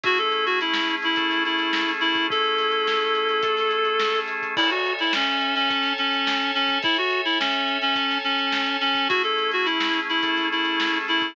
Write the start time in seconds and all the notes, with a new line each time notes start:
0.03 A3 C#4 E4 F#4 G#4, kick, closed hi-hat
0.18 A4, closed hi-hat
0.32 closed hi-hat
0.46 F#4, closed hi-hat
0.61 E4, closed hi-hat
0.73 snare
0.90 closed hi-hat
1.02 E4, closed hi-hat
1.16 A3 C#4 G#4 A4, kick, closed hi-hat
1.31 snare, closed hi-hat
1.45 E4, closed hi-hat
1.59 closed hi-hat
1.73 snare
1.89 closed hi-hat
2.00 E4, closed hi-hat
2.15 kick, closed hi-hat
2.30 A3 C#4 E4 G#4 A4, kick, closed hi-hat
2.44 closed hi-hat
2.58 snare, closed hi-hat
2.72 closed hi-hat
2.87 snare
3.01 closed hi-hat
3.15 closed hi-hat
3.29 snare, closed hi-hat
3.43 A3 C#4 G#4 A4, kick, closed hi-hat
3.57 snare, closed hi-hat
3.71 closed hi-hat
3.85 closed hi-hat
4.00 snare
4.15 snare, closed hi-hat
4.28 closed hi-hat
4.42 kick, closed hi-hat
4.57 E4 A4 C#5 E5 G#5, kick, crash
4.70 F#4, closed hi-hat
4.85 closed hi-hat
4.99 E4, closed hi-hat
5.13 C#4, snare
5.27 closed hi-hat
5.41 closed hi-hat
5.55 C#4, closed hi-hat
5.70 A4 C#5 G#5 A5, kick, closed hi-hat
5.83 snare, closed hi-hat
5.98 C#4, closed hi-hat
6.13 closed hi-hat
6.27 snare
6.40 snare, closed hi-hat
6.54 C#4, snare, closed hi-hat
6.68 kick, closed hi-hat
6.82 E4 A4 C#5 E5 G#5, kick, closed hi-hat
6.96 F#4, snare, closed hi-hat
7.11 closed hi-hat
7.25 E4, closed hi-hat
7.40 C#4, snare
7.53 closed hi-hat
7.68 closed hi-hat
7.82 C#4, closed hi-hat
7.96 A4 C#5 G#5 A5, kick, closed hi-hat
8.11 snare, closed hi-hat
8.24 C#4, snare, closed hi-hat
8.39 closed hi-hat
8.52 snare
8.66 closed hi-hat
8.81 C#4, closed hi-hat
8.95 kick, closed hi-hat
9.09 A3 C#4 E4 F#4 G#4, kick, closed hi-hat
9.23 A4, closed hi-hat
9.38 closed hi-hat
9.51 F#4, closed hi-hat
9.65 E4, closed hi-hat
9.80 snare
9.94 closed hi-hat
10.09 E4, closed hi-hat
10.23 A3 C#4 G#4 A4, kick, closed hi-hat
10.37 snare, closed hi-hat
10.52 E4, closed hi-hat
10.65 closed hi-hat
10.80 snare
10.94 closed hi-hat
11.08 E4, closed hi-hat
11.22 kick, closed hi-hat